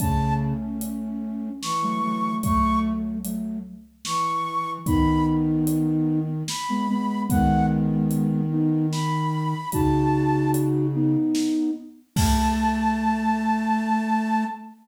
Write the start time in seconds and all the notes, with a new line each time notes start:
0.00 C#3 A3 C#4 A5, kick, closed hi-hat
0.81 closed hi-hat
1.62 E3 C#6, snare
1.82 F#3 A3
2.03 F#3 A3
2.43 F#3 A3 C#6, kick, closed hi-hat
3.24 F#3 A3, closed hi-hat
4.05 E3 C#6, snare
4.86 D#3 B3 D#4 B5, kick, closed hi-hat
5.67 closed hi-hat
6.48 B5, snare
6.69 G#3 B3
6.89 G#3 B3
7.29 D#3 G#3 B3 F#5, kick, closed hi-hat
8.11 closed hi-hat
8.51 B3 D#4
8.92 B5, snare
9.72 C#3 D#4 F#4 A5, kick, closed hi-hat
10.54 closed hi-hat
10.94 B3 D#4
11.35 snare
12.16 A3 A5, kick, crash